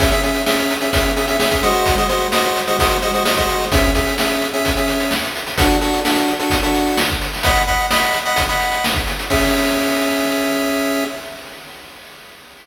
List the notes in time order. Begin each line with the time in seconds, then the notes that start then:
0.00 C#4 G#4 E5, kick, closed hi-hat
0.12 C#4 G#4 E5, closed hi-hat
0.23 C#4 G#4 E5, closed hi-hat
0.34 closed hi-hat
0.46 C#4 G#4 E5, snare
0.59 closed hi-hat
0.70 closed hi-hat
0.81 C#4 G#4 E5, closed hi-hat
0.93 C#4 G#4 E5, kick, closed hi-hat
1.06 closed hi-hat
1.16 C#4 G#4 E5, closed hi-hat
1.27 C#4 G#4 E5, closed hi-hat
1.40 C#4 G#4 E5, snare
1.51 C#4 G#4 E5, kick, closed hi-hat
1.63 G#3 F#4 C5 D#5, closed hi-hat
1.74 closed hi-hat
1.86 kick, closed hi-hat
1.97 G#3 F#4 C5 D#5, closed hi-hat
2.09 G#3 F#4 C5 D#5, closed hi-hat
2.20 closed hi-hat
2.32 G#3 F#4 C5 D#5, snare
2.44 closed hi-hat
2.56 closed hi-hat
2.67 G#3 F#4 C5 D#5, closed hi-hat
2.79 G#3 F#4 C5 D#5, kick, closed hi-hat
2.91 closed hi-hat
3.02 G#3 F#4 C5 D#5, closed hi-hat
3.14 G#3 F#4 C5 D#5, closed hi-hat
3.25 G#3 F#4 C5 D#5, snare
3.37 G#3 F#4 C5 D#5, kick, closed hi-hat
3.49 closed hi-hat
3.61 closed hi-hat
3.72 C#4 G#4 E5, kick, closed hi-hat
3.84 kick, closed hi-hat
3.95 C#4 G#4 E5, kick, closed hi-hat
4.07 closed hi-hat
4.18 C#4 G#4 E5, snare
4.31 closed hi-hat
4.42 closed hi-hat
4.53 C#4 G#4 E5, closed hi-hat
4.65 kick, closed hi-hat
4.76 C#4 G#4 E5, closed hi-hat
4.88 closed hi-hat
5.00 closed hi-hat
5.11 snare
5.24 closed hi-hat
5.35 closed hi-hat
5.47 closed hi-hat
5.58 D4 F#4 A4, kick, closed hi-hat
5.70 closed hi-hat
5.81 D4 F#4 A4, closed hi-hat
5.93 closed hi-hat
6.05 D4 F#4 A4, snare
6.16 closed hi-hat
6.28 closed hi-hat
6.39 D4 F#4 A4, closed hi-hat
6.50 kick, closed hi-hat
6.63 D4 F#4 A4, closed hi-hat
6.74 closed hi-hat
6.87 closed hi-hat
6.97 snare
7.09 kick, closed hi-hat
7.22 closed hi-hat
7.33 open hi-hat
7.43 D#5 F#5 B5, kick, closed hi-hat
7.55 closed hi-hat
7.67 D#5 F#5 B5, kick, closed hi-hat
7.79 closed hi-hat
7.91 D#5 F#5 B5, snare
8.02 closed hi-hat
8.13 closed hi-hat
8.25 D#5 F#5 B5, closed hi-hat
8.36 kick, closed hi-hat
8.49 D#5 F#5 B5, closed hi-hat
8.60 closed hi-hat
8.72 closed hi-hat
8.84 snare
8.94 kick, closed hi-hat
9.07 closed hi-hat
9.19 closed hi-hat
9.30 C#4 G#4 E5, kick, crash